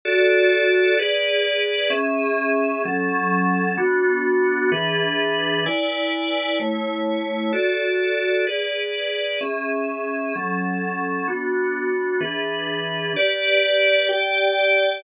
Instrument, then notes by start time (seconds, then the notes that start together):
drawbar organ
0.05 F#4 A4 D5
0.99 G#4 B4 D5
1.90 C#4 G#4 E5
2.85 F#3 C#4 A4
3.78 B3 D4 F#4
4.72 E3 D4 G#4 B4
5.66 E4 B4 D5 G#5
6.60 A3 E4 C#5
7.53 F#4 A4 D5
8.47 G#4 B4 D5
9.41 C#4 G#4 E5
10.36 F#3 C#4 A4
11.28 B3 D4 F#4
12.21 E3 D4 G#4 B4
13.16 G4 B4 D5
14.09 G4 D5 G5